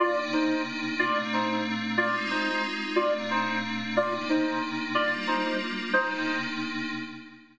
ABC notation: X:1
M:3/4
L:1/8
Q:"Swing" 1/4=182
K:Cm
V:1 name="Clarinet"
[Fd] z [Ec]2 z2 | [Fd] z [Ec]2 z2 | [Fd] z [Ec]2 z2 | [Fd] z [Ec]2 z2 |
[Fd] z [Ec]2 z2 | [Fd] z [Ec]2 z2 | [Ec]3 z3 |]
V:2 name="Pad 5 (bowed)"
[C,B,DE]6 | [B,,=A,CD]6 | [A,CEF]6 | [B,,=A,CD]6 |
[C,B,DE]6 | [G,B,DF]6 | [C,B,DE]6 |]